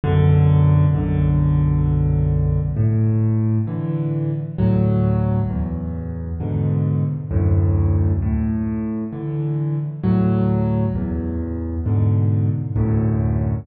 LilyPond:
\new Staff { \clef bass \time 3/4 \key fis \minor \tempo 4 = 66 <b,, fis, d>4 <b,, fis, d>2 | \key a \major a,4 <d e>4 <d, a, fis>4 | e,4 <gis, b, d>4 <d, fis, a,>4 | a,4 <d e>4 <d, a, fis>4 |
e,4 <gis, b, d>4 <d, fis, a,>4 | }